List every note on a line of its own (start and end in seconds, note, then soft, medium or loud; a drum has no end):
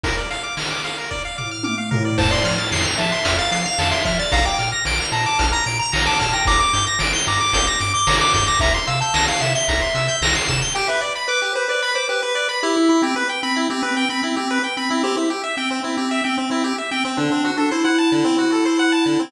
0.03 0.16 A#4 medium
0.03 kick loud
0.03 closed hi-hat loud
0.17 0.29 D5 medium
0.30 0.43 F5 medium
0.30 closed hi-hat medium
0.43 0.55 D6 medium
0.57 0.69 F6 medium
0.57 snare loud
0.70 0.82 D6 medium
0.84 0.96 F5 medium
0.84 closed hi-hat medium
0.98 1.10 A#4 medium
1.10 1.23 D5 medium
1.10 kick medium
1.25 1.37 F5 medium
1.38 1.50 D6 medium
1.38 floor tom medium
1.51 1.63 F6 medium
1.63 1.76 D6 medium
1.63 high tom medium
1.78 1.90 F5 medium
1.91 2.03 A#4 medium
1.91 floor tom loud
2.05 2.17 D5 medium
2.18 2.33 F2 loud
2.18 2.30 C5 medium
2.18 2.30 A5 loud
2.18 kick loud
2.18 crash loud
2.31 2.54 D5 medium
2.31 2.43 C6 medium
2.44 2.59 F3 medium
2.44 2.57 F6 medium
2.44 closed hi-hat medium
2.58 2.70 A6 medium
2.71 2.86 F2 medium
2.71 2.84 C7 medium
2.71 snare loud
2.85 2.97 F7 medium
2.98 3.13 F3 medium
2.98 3.37 E5 medium
2.98 3.10 A5 medium
2.98 closed hi-hat medium
3.12 3.24 C6 medium
3.25 3.40 F2 medium
3.25 3.37 F6 medium
3.25 kick medium
3.25 closed hi-hat loud
3.39 3.61 F5 medium
3.39 3.51 A6 medium
3.51 3.66 F3 medium
3.51 3.64 C7 medium
3.51 closed hi-hat medium
3.65 3.89 F5 medium
3.65 3.78 F7 loud
3.78 3.93 F2 medium
3.78 3.91 A5 medium
3.78 snare loud
3.91 4.04 E5 medium
3.91 4.03 C6 medium
4.05 4.20 F3 loud
4.05 4.18 E5 medium
4.05 4.17 F6 medium
4.05 kick loud
4.05 closed hi-hat medium
4.19 4.32 D5 medium
4.19 4.31 A6 medium
4.32 4.46 A#1 loud
4.32 4.45 F5 medium
4.32 4.44 A#5 medium
4.32 kick loud
4.32 closed hi-hat loud
4.45 4.69 G5 medium
4.45 4.57 D6 medium
4.58 4.74 A#2 medium
4.58 4.71 F6 medium
4.58 closed hi-hat medium
4.72 4.84 A#6 medium
4.85 5.00 A#1 medium
4.85 4.98 D7 loud
4.85 snare loud
4.99 5.11 F7 medium
5.12 5.27 A#2 medium
5.12 5.47 A5 medium
5.12 5.25 A#5 medium
5.12 closed hi-hat medium
5.26 5.38 D6 medium
5.39 5.54 A#1 loud
5.39 5.51 F6 medium
5.39 kick medium
5.39 closed hi-hat loud
5.52 5.77 A#5 medium
5.52 5.65 A#6 medium
5.66 5.81 A#2 medium
5.66 5.78 D7 medium
5.66 closed hi-hat medium
5.79 6.02 A#5 medium
5.79 5.91 F7 medium
5.92 6.08 A#1 medium
5.92 6.04 A#5 medium
5.92 snare loud
6.06 6.19 A5 medium
6.06 6.18 D6 medium
6.19 6.34 A#2 medium
6.19 6.33 A5 medium
6.19 6.31 F6 medium
6.19 kick medium
6.19 closed hi-hat medium
6.33 6.46 G5 medium
6.33 6.45 A#6 medium
6.45 6.61 G1 loud
6.45 6.59 A#5 loud
6.45 6.59 D6 loud
6.45 kick loud
6.45 closed hi-hat loud
6.59 6.85 D6 medium
6.59 6.72 D6 medium
6.73 6.88 G2 medium
6.73 6.85 G6 medium
6.73 closed hi-hat medium
6.87 6.99 A#6 medium
6.99 7.15 G1 medium
6.99 7.12 D7 medium
6.99 snare loud
7.13 7.25 G7 medium
7.26 7.42 G2 medium
7.26 7.39 A#5 medium
7.26 7.67 D6 medium
7.26 closed hi-hat medium
7.41 7.53 D6 medium
7.53 7.68 G1 loud
7.53 7.66 G6 loud
7.53 kick loud
7.53 closed hi-hat loud
7.67 7.92 D6 medium
7.67 7.79 A#6 medium
7.79 7.95 G2 loud
7.79 7.93 D7 medium
7.79 closed hi-hat medium
7.94 8.16 D6 medium
7.94 8.06 G7 medium
8.07 8.22 G1 medium
8.07 8.19 A#5 medium
8.07 snare loud
8.20 8.32 D6 medium
8.20 8.33 D6 medium
8.33 8.49 G2 loud
8.33 8.46 D6 medium
8.33 8.46 G6 medium
8.33 kick medium
8.33 closed hi-hat medium
8.47 8.60 D6 medium
8.47 8.59 A#6 medium
8.59 8.75 C2 loud
8.59 8.73 E5 medium
8.59 8.73 A#5 loud
8.59 kick loud
8.59 closed hi-hat loud
8.74 8.86 C6 medium
8.87 9.03 C3 medium
8.87 9.00 F5 medium
8.87 8.99 E6 medium
8.87 closed hi-hat medium
9.01 9.25 A5 medium
9.01 9.14 G6 medium
9.14 9.29 C2 medium
9.14 9.26 A#6 medium
9.14 snare loud
9.28 9.41 F5 medium
9.28 9.40 C7 medium
9.41 9.56 C3 medium
9.41 9.54 E5 medium
9.41 9.53 E7 medium
9.41 closed hi-hat medium
9.54 10.16 E5 medium
9.54 9.67 G7 medium
9.68 9.83 C2 medium
9.68 9.80 A#5 medium
9.68 kick medium
9.68 closed hi-hat loud
9.81 9.93 C6 medium
9.95 10.09 C3 medium
9.95 10.07 E6 medium
9.95 closed hi-hat medium
10.08 10.20 G6 medium
10.21 10.36 C2 medium
10.21 10.34 A#6 medium
10.21 snare loud
10.35 10.47 C7 medium
10.48 10.62 C3 medium
10.48 10.60 E7 loud
10.48 kick loud
10.48 closed hi-hat medium
10.62 10.74 G7 medium
10.75 10.87 G4 loud
10.75 10.87 G5 loud
10.88 11.01 B4 medium
10.88 11.01 E5 medium
11.01 11.13 D5 medium
11.15 11.27 B5 medium
11.28 11.52 B4 medium
11.28 11.41 D6 loud
11.42 11.54 G4 medium
11.55 11.68 B4 medium
11.55 11.68 C5 medium
11.68 11.91 B4 medium
11.68 11.81 D5 medium
11.82 11.94 B5 loud
11.95 12.08 C5 medium
11.95 12.07 D6 medium
12.09 12.21 G4 medium
12.09 12.22 B4 medium
12.22 12.34 B4 medium
12.22 12.48 B4 medium
12.35 12.47 D5 medium
12.49 12.61 B5 medium
12.63 13.02 E4 loud
12.63 12.75 G4 medium
12.76 12.89 E4 medium
12.89 13.02 E4 medium
13.02 13.15 C4 medium
13.02 13.15 G4 medium
13.16 13.28 B4 loud
13.29 13.41 G5 medium
13.43 13.67 C4 medium
13.43 13.55 B5 loud
13.56 13.68 E4 medium
13.70 13.82 C4 medium
13.70 13.82 G4 medium
13.83 14.05 C4 medium
13.83 13.95 B4 medium
13.97 14.09 G5 loud
14.09 14.22 C4 medium
14.09 14.22 B5 medium
14.23 14.36 C4 medium
14.23 14.36 E4 medium
14.36 14.59 C4 medium
14.36 14.48 G4 medium
14.51 14.63 B4 medium
14.64 14.76 G5 medium
14.77 14.90 C4 medium
14.77 14.89 B5 medium
14.90 15.03 C4 medium
14.90 15.02 E4 medium
15.03 15.16 C4 loud
15.03 15.16 G4 loud
15.17 15.29 E4 medium
15.30 15.42 G4 medium
15.44 15.56 E5 medium
15.57 15.80 C4 medium
15.57 15.69 G5 medium
15.70 15.82 C4 medium
15.84 15.97 C4 medium
15.84 15.96 E4 medium
15.97 16.21 C4 medium
15.97 16.09 G4 medium
16.11 16.23 E5 loud
16.24 16.37 C4 medium
16.24 16.36 G5 medium
16.37 16.49 C4 medium
16.37 16.50 C4 medium
16.50 16.73 C4 medium
16.50 16.63 E4 medium
16.64 16.76 G4 medium
16.78 16.90 E5 medium
16.91 17.04 C4 medium
16.91 17.03 G5 medium
17.05 17.17 C4 medium
17.05 17.18 C4 medium
17.17 17.30 D3 loud
17.17 17.51 D4 medium
17.31 17.43 C4 medium
17.45 17.57 F#4 medium
17.57 17.71 D4 medium
17.57 17.69 A4 medium
17.71 17.84 E4 medium
17.71 17.83 C5 medium
17.84 19.22 E4 medium
17.84 17.96 F#5 medium
17.98 18.10 A5 medium
18.12 18.24 D3 medium
18.24 18.36 C4 loud
18.38 18.50 F#4 medium
18.52 18.64 A4 medium
18.65 18.77 C5 medium
18.79 18.91 F#5 loud
18.92 19.04 A5 medium
19.06 19.18 D3 medium
19.19 19.31 C4 medium